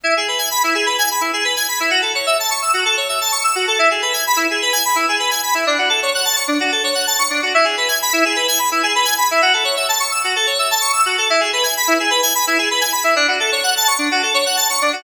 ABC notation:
X:1
M:4/4
L:1/16
Q:1/4=128
K:F#m
V:1 name="Electric Piano 2"
E G B g b E G B g b E G B g b E | F A c e a c' e' F A c e a c' e' F A | E G B g b E G B g b E G B g b E | D F A c f a c' D F A c f a c' D F |
E G B g b E G B g b E G B g b E | F A c e a c' e' F A c e a c' e' F A | E G B g b E G B g b E G B g b E | D F A c f a c' D F A c f a c' D F |]